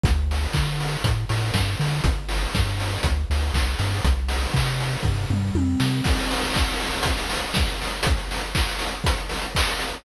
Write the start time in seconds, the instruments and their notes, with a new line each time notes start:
0.04 synth bass 1 D2, kick, closed hi-hat
0.31 open hi-hat
0.53 synth bass 1 D3, kick, clap
0.81 open hi-hat
1.04 synth bass 1 A2, kick, closed hi-hat
1.29 synth bass 1 A2, open hi-hat
1.54 synth bass 1 G2, kick, snare
1.80 synth bass 1 D3, open hi-hat
2.04 synth bass 1 G1, kick, closed hi-hat
2.29 open hi-hat
2.55 synth bass 1 G2, kick, snare
2.80 open hi-hat
3.03 synth bass 1 D2, kick, closed hi-hat
3.30 synth bass 1 D2, open hi-hat
3.54 synth bass 1 C2, kick, clap
3.79 synth bass 1 G2, open hi-hat
4.05 synth bass 1 C2, kick, closed hi-hat
4.29 open hi-hat
4.54 synth bass 1 C3, kick, clap
4.80 open hi-hat
5.03 synth bass 1 G2, kick, floor tom
5.30 synth bass 1 G2, mid tom
5.55 synth bass 1 F2, high tom
5.80 synth bass 1 C3, snare
6.04 kick, crash
6.19 closed hi-hat
6.31 open hi-hat
6.41 closed hi-hat
6.54 kick, clap
6.68 closed hi-hat
6.80 open hi-hat
6.93 closed hi-hat
7.03 kick, closed hi-hat
7.18 closed hi-hat
7.30 open hi-hat
7.42 closed hi-hat
7.54 kick, snare
7.66 closed hi-hat
7.82 open hi-hat
7.91 closed hi-hat
8.03 kick, closed hi-hat
8.17 closed hi-hat
8.31 open hi-hat
8.43 closed hi-hat
8.55 kick, clap
8.69 closed hi-hat
8.79 open hi-hat
8.91 closed hi-hat
9.04 kick, closed hi-hat
9.17 closed hi-hat
9.29 open hi-hat
9.42 closed hi-hat
9.55 kick, clap
9.68 closed hi-hat
9.79 open hi-hat
9.93 closed hi-hat